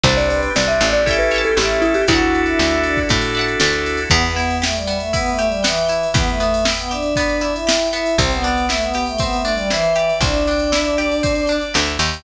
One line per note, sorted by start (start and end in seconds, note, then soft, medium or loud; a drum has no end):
0.03 0.49 C2 loud
0.03 0.50 C4 loud
0.03 1.05 C4 medium
0.03 0.50 D4 loud
0.03 1.05 D4 medium
0.03 0.50 G4 medium
0.03 1.05 G4 medium
0.03 0.17 C5 medium
0.03 0.17 C5 loud
0.03 0.99 C5 medium
0.03 0.99 D5 medium
0.03 kick loud
0.03 ride loud
0.09 0.99 G5 medium
0.17 0.30 C5 medium
0.17 0.28 D5 loud
0.17 ride medium
0.29 0.52 B4 medium
0.29 0.41 D5 loud
0.29 ride loud
0.42 ride medium
0.55 0.80 C2 medium
0.55 1.01 C4 medium
0.55 1.01 D4 medium
0.55 1.01 G4 medium
0.55 0.68 D5 medium
0.55 snare loud
0.67 0.89 E5 loud
0.67 ride medium
0.80 1.52 A1 medium
0.80 1.02 D5 medium
0.80 ride medium
0.93 1.17 D5 loud
0.93 ride medium
1.06 1.51 C#4 loud
1.06 2.07 C#4 medium
1.06 1.51 E4 loud
1.06 2.07 E4 medium
1.06 1.51 G4 loud
1.06 2.07 G4 medium
1.06 1.51 A4 loud
1.06 2.07 A4 medium
1.06 1.30 C#5 medium
1.06 1.28 E5 medium
1.06 1.30 E5 medium
1.06 kick loud
1.06 ride loud
1.11 1.30 G5 medium
1.11 1.30 A5 medium
1.19 1.42 B4 loud
1.19 ride medium
1.31 1.55 C#5 medium
1.31 1.55 E5 medium
1.31 ride loud
1.36 1.55 G5 medium
1.36 1.55 A5 medium
1.44 1.57 A4 medium
1.44 ride medium
1.56 2.03 A1 medium
1.56 2.02 C#4 medium
1.56 2.02 E4 medium
1.56 2.02 G4 loud
1.56 1.82 G4 medium
1.56 2.02 A4 medium
1.56 2.04 C#5 medium
1.56 2.00 E5 medium
1.56 2.04 E5 medium
1.56 snare loud
1.61 2.04 G5 medium
1.61 2.04 A5 medium
1.70 ride medium
1.82 1.94 E4 loud
1.82 ride medium
1.94 2.07 G4 loud
1.94 ride medium
2.08 2.54 D2 medium
2.08 4.09 D4 medium
2.08 2.99 D4 loud
2.08 4.09 E4 medium
2.08 2.99 E4 loud
2.08 2.75 E4 loud
2.08 4.09 F#4 medium
2.08 2.99 F#4 loud
2.08 2.40 F#4 medium
2.08 4.09 A4 medium
2.08 2.99 A4 loud
2.08 3.25 D5 medium
2.08 3.25 E5 medium
2.08 kick loud
2.08 ride loud
2.13 3.25 F#5 medium
2.13 3.25 A5 medium
2.20 ride medium
2.35 ride medium
2.46 2.81 E4 medium
2.46 ride medium
2.59 3.05 D2 medium
2.59 snare loud
2.71 ride medium
2.83 3.05 D4 medium
2.83 ride medium
2.97 kick medium
2.97 ride medium
3.09 3.56 A2 medium
3.09 4.01 D4 medium
3.09 4.01 E4 medium
3.09 4.01 F#4 medium
3.09 4.01 A4 medium
3.09 kick loud
3.09 ride loud
3.21 ride loud
3.35 3.58 D5 medium
3.35 3.58 E5 medium
3.35 ride medium
3.39 3.58 F#5 medium
3.39 3.58 A5 medium
3.48 ride medium
3.60 4.06 D2 medium
3.60 4.07 D5 medium
3.60 4.07 E5 medium
3.60 snare loud
3.65 4.07 F#5 medium
3.65 4.07 A5 medium
3.73 ride medium
3.86 ride loud
3.97 ride medium
4.10 5.98 E2 loud
4.10 4.22 B3 loud
4.10 4.87 B3 medium
4.10 4.34 B4 loud
4.10 kick loud
4.10 crash loud
4.24 4.56 B3 medium
4.24 ride medium
4.35 5.13 E4 medium
4.35 4.58 E5 medium
4.35 ride medium
4.50 ride medium
4.62 4.74 A3 medium
4.62 5.38 G4 medium
4.62 4.87 G5 medium
4.62 snare loud
4.75 4.97 G3 medium
4.75 ride medium
4.87 5.63 B3 medium
4.87 5.12 E5 medium
4.87 ride medium
5.00 5.12 A3 medium
5.00 ride medium
5.13 5.30 B3 medium
5.13 5.89 E4 medium
5.13 5.37 B4 medium
5.13 kick medium
5.13 ride loud
5.26 5.45 A3 medium
5.26 ride medium
5.39 6.14 G4 medium
5.39 5.61 E5 medium
5.39 ride medium
5.47 5.63 G3 medium
5.52 ride medium
5.62 6.06 E3 medium
5.62 6.40 B3 medium
5.62 5.85 G5 medium
5.62 snare loud
5.78 ride medium
5.88 6.65 E4 medium
5.88 6.11 E5 medium
5.88 ride medium
6.03 ride medium
6.14 8.01 E2 medium
6.14 6.27 B3 loud
6.14 6.90 G4 medium
6.14 6.39 B4 medium
6.14 kick loud
6.14 ride loud
6.27 6.64 A3 medium
6.27 ride medium
6.40 7.16 B3 medium
6.40 6.65 E5 medium
6.40 ride medium
6.54 ride loud
6.65 7.41 E4 medium
6.65 6.88 G5 medium
6.65 snare loud
6.79 6.91 B3 medium
6.79 ride medium
6.91 7.51 D4 medium
6.91 7.66 G4 medium
6.91 7.14 E5 medium
6.91 ride medium
7.02 ride medium
7.16 7.92 B3 medium
7.16 7.41 B4 medium
7.16 kick medium
7.16 ride loud
7.29 ride medium
7.41 8.14 E4 medium
7.41 7.65 E5 medium
7.41 ride medium
7.54 7.87 E4 medium
7.54 ride medium
7.67 8.15 G4 medium
7.67 7.92 G5 medium
7.67 snare loud
7.80 ride medium
7.93 8.17 B3 medium
7.93 8.15 E4 medium
7.93 8.17 E5 medium
7.93 ride medium
8.06 ride medium
8.18 10.05 C2 medium
8.18 9.19 C4 medium
8.18 8.31 C4 loud
8.18 8.42 C5 medium
8.18 kick loud
8.18 ride loud
8.31 8.66 B3 medium
8.31 ride medium
8.43 9.44 D4 medium
8.43 8.65 D5 medium
8.43 ride medium
8.57 ride medium
8.69 8.81 A3 medium
8.69 9.70 E4 medium
8.69 8.92 E5 medium
8.69 snare loud
8.81 9.04 B3 medium
8.81 ride medium
8.94 9.95 G4 medium
8.94 9.17 G5 medium
8.94 ride medium
9.06 9.19 A3 medium
9.06 ride medium
9.18 9.37 B3 medium
9.18 10.21 C4 medium
9.18 9.42 E5 medium
9.18 kick loud
9.18 ride loud
9.33 9.52 A3 medium
9.33 ride medium
9.44 10.47 D4 medium
9.44 9.67 D5 medium
9.44 ride medium
9.53 9.69 G3 medium
9.58 ride medium
9.70 10.12 E3 loud
9.70 10.72 E4 medium
9.70 9.93 C5 medium
9.70 snare loud
9.82 ride medium
9.95 10.98 G4 medium
9.95 10.19 D5 medium
9.95 ride medium
10.09 ride medium
10.21 11.65 C2 medium
10.21 11.23 C4 medium
10.21 11.56 D4 medium
10.21 10.45 E5 medium
10.21 kick loud
10.21 ride loud
10.34 ride medium
10.47 11.48 D4 medium
10.47 10.71 G5 medium
10.47 ride medium
10.59 ride medium
10.72 11.74 E4 medium
10.72 10.97 E5 medium
10.72 snare loud
10.85 ride medium
10.97 11.99 G4 medium
10.97 11.20 D5 medium
10.97 ride medium
11.11 ride medium
11.23 12.20 C4 medium
11.23 11.46 C5 medium
11.23 kick loud
11.23 ride loud
11.35 ride medium
11.47 12.21 D4 medium
11.47 11.73 D5 medium
11.47 ride medium
11.61 ride medium
11.74 11.98 D2 medium
11.74 12.22 E4 medium
11.74 11.97 E5 medium
11.74 snare loud
11.86 ride medium
11.99 12.22 D#2 medium
11.99 12.23 G4 medium
11.99 12.23 G5 medium
11.99 ride medium
12.13 ride medium